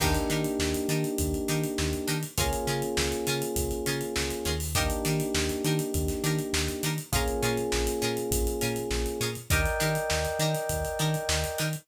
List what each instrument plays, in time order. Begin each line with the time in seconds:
0.00 synth bass 1 D#2, electric piano 1 A#3 D4 D#4 G4, pizzicato strings D4 D#4 G4 A#4, kick, crash
0.14 closed hi-hat
0.30 synth bass 1 D#3, pizzicato strings D4 D#4 G4 A#4, closed hi-hat
0.44 closed hi-hat
0.59 synth bass 1 D#2, snare
0.74 closed hi-hat
0.88 synth bass 1 D#3, pizzicato strings D4 D#4 G4 A#4, closed hi-hat
1.04 closed hi-hat
1.18 synth bass 1 D#2, kick, closed hi-hat
1.34 closed hi-hat
1.48 synth bass 1 D#3, pizzicato strings D4 D#4 G4 A#4, closed hi-hat
1.64 closed hi-hat
1.78 synth bass 1 D#2, snare
1.93 closed hi-hat
2.08 synth bass 1 D#3, pizzicato strings D4 D#4 G4 A#4, closed hi-hat
2.23 closed hi-hat
2.38 synth bass 1 C#2, electric piano 1 A#3 C#4 F4 G#4, pizzicato strings C#4 F4 G#4 A#4, kick, closed hi-hat
2.53 closed hi-hat
2.67 synth bass 1 C#3, pizzicato strings C#4 F4 G#4 A#4, closed hi-hat
2.82 closed hi-hat
2.97 synth bass 1 C#2, snare
3.12 closed hi-hat
3.27 synth bass 1 C#3, pizzicato strings C#4 F4 G#4 A#4, closed hi-hat
3.42 closed hi-hat
3.56 synth bass 1 C#2, kick, closed hi-hat
3.71 closed hi-hat
3.86 synth bass 1 C#3, pizzicato strings C#4 F4 G#4 A#4, closed hi-hat
4.01 closed hi-hat
4.16 synth bass 1 C#2, snare
4.30 closed hi-hat
4.45 synth bass 1 D#2, pizzicato strings C#4 F4 G#4 A#4, snare, closed hi-hat
4.60 open hi-hat
4.75 electric piano 1 A#3 D4 D#4 G4, pizzicato strings D4 D#4 G4 A#4, kick, closed hi-hat
4.90 closed hi-hat
5.05 synth bass 1 D#3, pizzicato strings D4 D#4 G4 A#4, snare, closed hi-hat
5.20 closed hi-hat
5.35 synth bass 1 D#2, snare
5.49 closed hi-hat
5.64 synth bass 1 D#3, pizzicato strings D4 D#4 G4 A#4, closed hi-hat
5.79 closed hi-hat
5.94 synth bass 1 D#2, kick, closed hi-hat
6.08 snare, closed hi-hat
6.24 synth bass 1 D#3, pizzicato strings D4 D#4 G4 A#4, closed hi-hat
6.39 closed hi-hat
6.53 synth bass 1 D#2, snare
6.68 closed hi-hat
6.83 synth bass 1 D#3, pizzicato strings D4 D#4 G4 A#4, closed hi-hat
6.98 closed hi-hat
7.12 synth bass 1 A#1, electric piano 1 A#3 C#4 F4 G#4, pizzicato strings C#4 F4 G#4 A#4, kick, closed hi-hat
7.28 closed hi-hat
7.43 synth bass 1 A#2, pizzicato strings C#4 F4 G#4 A#4, closed hi-hat
7.57 closed hi-hat
7.72 synth bass 1 A#1, snare
7.87 closed hi-hat
8.02 synth bass 1 A#2, pizzicato strings C#4 F4 G#4 A#4, closed hi-hat
8.17 closed hi-hat
8.31 synth bass 1 A#1, kick, closed hi-hat
8.47 closed hi-hat
8.61 synth bass 1 A#2, pizzicato strings C#4 F4 G#4 A#4, closed hi-hat
8.76 closed hi-hat
8.91 synth bass 1 A#1, snare
9.06 closed hi-hat
9.20 synth bass 1 A#2, pizzicato strings C#4 F4 G#4 A#4, closed hi-hat
9.35 closed hi-hat
9.50 synth bass 1 D#2, pizzicato strings D4 D#4 G4 A#4, electric piano 1 A#4 D5 D#5 G5, kick, closed hi-hat
9.65 snare, closed hi-hat
9.80 synth bass 1 D#3, pizzicato strings D4 D#4 G4 A#4, closed hi-hat
9.95 closed hi-hat
10.10 synth bass 1 D#2, snare
10.25 snare, closed hi-hat
10.39 synth bass 1 D#3, pizzicato strings D4 D#4 G4 A#4, closed hi-hat
10.55 snare, closed hi-hat
10.69 synth bass 1 D#2, kick, closed hi-hat
10.85 closed hi-hat
10.99 synth bass 1 D#3, pizzicato strings D4 D#4 G4 A#4, closed hi-hat
11.14 closed hi-hat
11.29 synth bass 1 D#2, snare
11.44 closed hi-hat
11.58 synth bass 1 D#3, pizzicato strings D4 D#4 G4 A#4, closed hi-hat
11.73 closed hi-hat